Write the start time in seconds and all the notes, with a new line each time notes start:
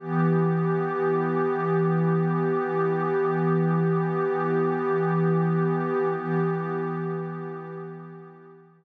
0.00 E3 B3 G4
6.15 E3 B3 G4